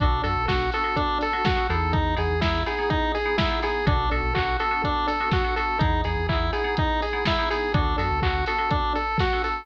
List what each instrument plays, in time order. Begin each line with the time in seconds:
0.00 synth bass 1 B1, electric piano 2 B3 D4 F#4 A4, lead 1 (square) D4, kick, closed hi-hat
0.23 synth bass 1 F#2, electric piano 2 B3 D4 F#4 A4, lead 1 (square) A4, open hi-hat
0.36 synth bass 1 B1
0.48 synth bass 1 B1, electric piano 2 B3 D4 F#4 A4, lead 1 (square) F#4, kick, snare
0.72 electric piano 2 B3 D4 F#4 A4, lead 1 (square) A4, open hi-hat
0.84 electric piano 2 B3 D4 F#4 A4
0.96 lead 1 (square) D4, kick, closed hi-hat
1.21 lead 1 (square) A4, open hi-hat
1.33 electric piano 2 B3 D4 F#4 A4
1.45 electric piano 2 B3 D4 F#4 A4, lead 1 (square) F#4, kick, snare
1.56 electric piano 2 B3 D4 F#4 A4
1.69 synth bass 1 E2, electric piano 2 B3 D#4 E4 G#4, lead 1 (square) A4, open hi-hat
1.93 lead 1 (square) D#4, kick, closed hi-hat
2.16 synth bass 1 E2, electric piano 2 B3 D#4 E4 G#4, lead 1 (square) G#4, open hi-hat
2.30 synth bass 1 E2
2.41 synth bass 1 E2, electric piano 2 B3 D#4 E4 G#4, lead 1 (square) E4, kick, snare
2.66 electric piano 2 B3 D#4 E4 G#4, lead 1 (square) G#4, open hi-hat
2.79 electric piano 2 B3 D#4 E4 G#4
2.90 lead 1 (square) D#4, kick, closed hi-hat
3.15 lead 1 (square) G#4, open hi-hat
3.25 electric piano 2 B3 D#4 E4 G#4
3.38 electric piano 2 B3 D#4 E4 G#4, lead 1 (square) E4, kick, snare
3.51 electric piano 2 B3 D#4 E4 G#4
3.63 electric piano 2 B3 D#4 E4 G#4, lead 1 (square) G#4, open hi-hat
3.86 synth bass 1 B1, electric piano 2 B3 D4 F#4 A4, lead 1 (square) D4, kick, closed hi-hat
4.11 synth bass 1 B1, electric piano 2 B3 D4 F#4 A4, lead 1 (square) A4, open hi-hat
4.23 synth bass 1 B1
4.35 synth bass 1 B1, electric piano 2 B3 D4 F#4 A4, lead 1 (square) F#4, kick, clap
4.59 electric piano 2 B3 D4 F#4 A4, lead 1 (square) A4, open hi-hat
4.71 electric piano 2 B3 D4 F#4 A4
4.84 lead 1 (square) D4, kick, closed hi-hat
5.07 lead 1 (square) A4, open hi-hat
5.20 electric piano 2 B3 D4 F#4 A4
5.31 electric piano 2 B3 D4 F#4 A4, lead 1 (square) F#4, kick, snare
5.44 electric piano 2 B3 D4 F#4 A4
5.56 electric piano 2 B3 D4 F#4 A4, lead 1 (square) A4, open hi-hat
5.79 synth bass 1 E2, electric piano 2 B3 D#4 E4 G#4, lead 1 (square) D#4, kick, closed hi-hat
6.04 synth bass 1 E2, electric piano 2 B3 D#4 E4 G#4, lead 1 (square) G#4, open hi-hat
6.17 synth bass 1 E2
6.29 synth bass 1 E2, electric piano 2 B3 D#4 E4 G#4, lead 1 (square) E4, kick, clap
6.53 electric piano 2 B3 D#4 E4 G#4, lead 1 (square) G#4, open hi-hat
6.64 electric piano 2 B3 D#4 E4 G#4
6.77 lead 1 (square) D#4, kick, closed hi-hat
7.02 lead 1 (square) G#4, open hi-hat
7.13 electric piano 2 B3 D#4 E4 G#4
7.25 electric piano 2 B3 D#4 E4 G#4, lead 1 (square) E4, kick, snare
7.39 electric piano 2 B3 D#4 E4 G#4
7.50 electric piano 2 B3 D#4 E4 G#4, lead 1 (square) G#4, open hi-hat
7.74 synth bass 1 D2, electric piano 2 B3 D4 F#4 A4, lead 1 (square) D4, kick, closed hi-hat
7.98 synth bass 1 F#2, electric piano 2 B3 D4 F#4 A4, lead 1 (square) A4, open hi-hat
8.10 synth bass 1 D2
8.22 synth bass 1 D2, electric piano 2 B3 D4 F#4 A4, lead 1 (square) F#4, kick, clap
8.46 electric piano 2 B3 D4 F#4 A4, lead 1 (square) A4, open hi-hat
8.58 electric piano 2 B3 D4 F#4 A4
8.71 lead 1 (square) D4, kick, closed hi-hat
8.95 lead 1 (square) A4, open hi-hat
9.18 lead 1 (square) F#4, kick, snare
9.33 electric piano 2 B3 D4 F#4 A4
9.44 lead 1 (square) A4, open hi-hat